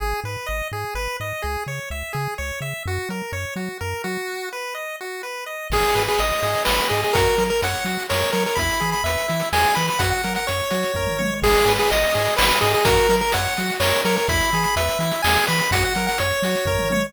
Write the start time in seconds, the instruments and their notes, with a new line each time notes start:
0.00 synth bass 1 G#1, lead 1 (square) G#4
0.24 synth bass 1 G#2, lead 1 (square) B4
0.46 synth bass 1 G#1, lead 1 (square) D#5
0.72 synth bass 1 G#2, lead 1 (square) G#4
0.95 synth bass 1 G#1, lead 1 (square) B4
1.20 synth bass 1 G#2, lead 1 (square) D#5
1.42 synth bass 1 C#2, lead 1 (square) G#4
1.67 synth bass 1 C#3, lead 1 (square) C#5
1.90 synth bass 1 C#2, lead 1 (square) E5
2.13 synth bass 1 C#3, lead 1 (square) G#4
2.38 synth bass 1 C#2, lead 1 (square) C#5
2.61 synth bass 1 C#3, lead 1 (square) E5
2.86 synth bass 1 F#2, lead 1 (square) F#4
3.09 synth bass 1 F#3, lead 1 (square) A#4
3.32 synth bass 1 F#2, lead 1 (square) C#5
3.56 synth bass 1 F#3, lead 1 (square) F#4
3.81 synth bass 1 F#2, lead 1 (square) A#4
4.04 synth bass 1 F#3, lead 1 (square) F#4
4.53 lead 1 (square) B4
4.75 lead 1 (square) D#5
5.01 lead 1 (square) F#4
5.23 lead 1 (square) B4
5.46 lead 1 (square) D#5
5.70 synth bass 1 G#1, lead 1 (square) G#4, kick, crash
5.84 closed hi-hat
5.95 synth bass 1 G#2, lead 1 (square) B4, closed hi-hat
6.08 lead 1 (square) G#4, closed hi-hat
6.18 synth bass 1 G#1, lead 1 (square) D#5, closed hi-hat
6.31 closed hi-hat
6.43 synth bass 1 G#2, lead 1 (square) G#4, closed hi-hat
6.54 closed hi-hat
6.65 synth bass 1 G#1, lead 1 (square) B4, snare
6.78 closed hi-hat
6.89 synth bass 1 G#2, lead 1 (square) G#4 D#5, closed hi-hat
7.03 lead 1 (square) G#4, closed hi-hat
7.13 synth bass 1 F#2, lead 1 (square) F#4 A#4, kick, closed hi-hat
7.26 closed hi-hat
7.38 synth bass 1 F#3, lead 1 (square) A#4, closed hi-hat
7.49 lead 1 (square) A#4, closed hi-hat
7.62 synth bass 1 F#2, lead 1 (square) C#5 F#5, closed hi-hat
7.74 closed hi-hat
7.85 synth bass 1 F#3, lead 1 (square) F#4, closed hi-hat
7.99 closed hi-hat
8.09 synth bass 1 F#2, lead 1 (square) A#4 C#5, snare
8.20 closed hi-hat
8.32 synth bass 1 F#3, lead 1 (square) A#4 C#5, closed hi-hat
8.46 lead 1 (square) A#4, closed hi-hat
8.55 synth bass 1 E2, lead 1 (square) E4 B5, kick, closed hi-hat
8.70 closed hi-hat
8.80 synth bass 1 E3, lead 1 (square) G#4, closed hi-hat
8.92 lead 1 (square) B5, closed hi-hat
9.04 synth bass 1 E2, lead 1 (square) B4 E5, closed hi-hat
9.18 closed hi-hat
9.28 synth bass 1 E3, lead 1 (square) E4, closed hi-hat
9.40 closed hi-hat
9.53 synth bass 1 E2, lead 1 (square) G#4 G#5, snare
9.65 closed hi-hat
9.75 synth bass 1 E3, lead 1 (square) B4 B5, closed hi-hat
9.87 lead 1 (square) B5, closed hi-hat
9.99 synth bass 1 F#2, lead 1 (square) F#4 F#5, kick, closed hi-hat
10.10 lead 1 (square) F#5, closed hi-hat
10.24 synth bass 1 F#3, lead 1 (square) A#4, closed hi-hat
10.35 lead 1 (square) F#5, closed hi-hat
10.47 synth bass 1 F#2, lead 1 (square) C#5, closed hi-hat
10.60 closed hi-hat
10.70 synth bass 1 F#3, lead 1 (square) F#4, closed hi-hat
10.83 closed hi-hat
10.94 synth bass 1 F#2, lead 1 (square) A#4, kick, floor tom
11.07 mid tom
11.19 synth bass 1 F#3, lead 1 (square) C#5, high tom
11.42 synth bass 1 G#1, lead 1 (square) G#4, kick, crash
11.55 closed hi-hat
11.65 synth bass 1 G#2, lead 1 (square) B4, closed hi-hat
11.78 lead 1 (square) G#4, closed hi-hat
11.91 synth bass 1 G#1, lead 1 (square) D#5, closed hi-hat
12.02 closed hi-hat
12.14 synth bass 1 G#2, lead 1 (square) G#4, closed hi-hat
12.25 closed hi-hat
12.36 synth bass 1 G#1, lead 1 (square) B4, snare
12.51 closed hi-hat
12.61 synth bass 1 G#2, lead 1 (square) G#4 D#5, closed hi-hat
12.74 lead 1 (square) G#4, closed hi-hat
12.85 synth bass 1 F#2, lead 1 (square) F#4 A#4, kick, closed hi-hat
12.97 closed hi-hat
13.09 synth bass 1 F#3, lead 1 (square) A#4, closed hi-hat
13.21 lead 1 (square) A#4, closed hi-hat
13.32 synth bass 1 F#2, lead 1 (square) C#5 F#5, closed hi-hat
13.45 closed hi-hat
13.57 synth bass 1 F#3, lead 1 (square) F#4, closed hi-hat
13.70 closed hi-hat
13.80 synth bass 1 F#2, lead 1 (square) A#4 C#5, snare
13.94 closed hi-hat
14.05 synth bass 1 F#3, lead 1 (square) A#4 C#5, closed hi-hat
14.16 lead 1 (square) A#4, closed hi-hat
14.28 synth bass 1 E2, lead 1 (square) E4 B5, kick, closed hi-hat
14.40 closed hi-hat
14.52 synth bass 1 E3, lead 1 (square) G#4, closed hi-hat
14.63 lead 1 (square) B5, closed hi-hat
14.76 synth bass 1 E2, lead 1 (square) B4 E5, closed hi-hat
14.88 closed hi-hat
14.99 synth bass 1 E3, lead 1 (square) E4, closed hi-hat
15.11 closed hi-hat
15.22 synth bass 1 E2, lead 1 (square) G#4 G#5, snare
15.35 closed hi-hat
15.47 synth bass 1 E3, lead 1 (square) B4 B5, closed hi-hat
15.59 lead 1 (square) B5, closed hi-hat
15.71 synth bass 1 F#2, lead 1 (square) F#4 F#5, kick, closed hi-hat
15.82 lead 1 (square) F#5, closed hi-hat
15.95 synth bass 1 F#3, lead 1 (square) A#4, closed hi-hat
16.07 lead 1 (square) F#5, closed hi-hat
16.18 synth bass 1 F#2, lead 1 (square) C#5, closed hi-hat
16.31 closed hi-hat
16.42 synth bass 1 F#3, lead 1 (square) F#4, closed hi-hat
16.55 closed hi-hat
16.65 synth bass 1 F#2, lead 1 (square) A#4, kick, floor tom
16.79 mid tom
16.90 synth bass 1 F#3, lead 1 (square) C#5, high tom